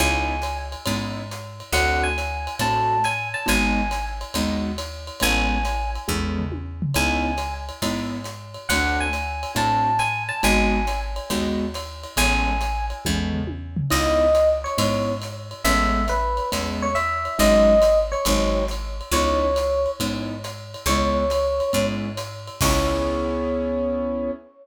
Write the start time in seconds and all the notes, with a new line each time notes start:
0.00 C#2 B3 C#4 D#4 E4 G#5, kick, ride
0.42 hi-hat pedal, ride
0.72 ride
0.86 G#2 B3 C#4 D#4 E4, kick, ride
1.31 hi-hat pedal, ride
1.60 ride
1.72 D2 A3 C4 D4 F#4 F#5, kick, ride
2.03 G#5
2.18 hi-hat pedal, ride
2.47 ride
2.59 A2 A3 C4 D4 F#4 A5, kick, ride
3.04 G#5, hi-hat pedal, ride
3.34 A5, ride
3.46 G#1 G#3 B3 D#4 F#4 G#5, kick, ride
3.91 hi-hat pedal, ride
4.21 ride
4.34 D#2 G#3 B3 D#4 F#4, kick, ride
4.78 hi-hat pedal, ride
5.07 ride
5.20 A1 G#3 A3 B3 C#4 G#5, kick, ride
5.65 hi-hat pedal, ride
5.95 ride
6.08 E2 G#3 A3 B3 C#4, kick, high tom
6.39 floor tom
6.52 high tom
6.82 floor tom
6.94 C#2 B3 C#4 D#4 E4 G#5, kick, ride
7.38 hi-hat pedal, ride
7.69 ride
7.82 G#2 B3 C#4 D#4 E4, kick, ride
8.24 hi-hat pedal, ride
8.54 ride
8.69 D2 A3 C4 D4 F#4 F#5, kick, ride
9.00 G#5
9.13 hi-hat pedal, ride
9.43 ride
9.55 A2 A3 C4 D4 F#4 A5, kick, ride
9.99 G#5, hi-hat pedal, ride
10.29 A5, ride
10.43 G#1 G#3 B3 D#4 F#4 G#5, kick, ride
10.87 hi-hat pedal, ride
11.16 ride
11.30 D#2 G#3 B3 D#4 F#4, kick, ride
11.74 hi-hat pedal, ride
12.04 ride
12.16 A1 G#3 A3 B3 C#4 G#5, kick, ride
12.61 hi-hat pedal, ride
12.90 ride
13.05 E2 G#3 A3 B3 C#4, kick, high tom
13.33 floor tom
13.47 high tom
13.77 floor tom
13.90 C#2 B3 C#4 D#4 E4 D#5, kick, crash, ride
14.35 hi-hat pedal, ride
14.64 C#5, ride
14.78 G#2 B3 C#4 D#4 E4, kick, ride
15.22 hi-hat pedal, ride
15.51 ride
15.64 A1 G#3 A3 B3 C#4 E5, kick, ride
16.08 B4, hi-hat pedal, ride
16.37 ride
16.52 E2 G#3 A3 B3 C#4, kick, ride
16.82 C#5
16.95 E5, hi-hat pedal, ride
17.25 ride
17.39 G#1 F#3 G#3 C#4 D#4 D#5, kick, ride
17.82 hi-hat pedal, ride
18.12 C#5, ride
18.25 G#1 F#3 G#3 C4 D#4, kick, ride
18.68 hi-hat pedal, ride
19.01 ride
19.12 C#2 B3 C#4 D#4 E4 C#5, kick, ride
19.56 hi-hat pedal, ride
19.86 ride
20.00 G#2 B3 C#4 D#4 E4, kick, ride
20.44 hi-hat pedal, ride
20.74 ride
20.86 C#2 G#3 B3 C#4 E4 C#5, kick, ride
21.30 hi-hat pedal, ride
21.60 ride
21.73 G#2 G#3 B3 C#4 E4, kick, ride
22.17 hi-hat pedal, ride
22.47 ride
22.61 C#2 B3 C#4 E4 G#4 C#5, kick, crash